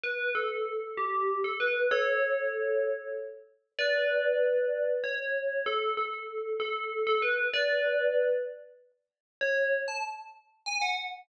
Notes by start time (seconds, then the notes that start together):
0.04 B4
0.35 A4
0.97 G4
1.44 A4
1.60 B4
1.91 A4 C#5
3.79 B4 D5
5.04 C#5
5.66 A4
5.97 A4
6.60 A4
7.07 A4
7.22 B4
7.54 B4 D5
9.41 C#5
9.88 A5
10.66 G#5
10.82 F#5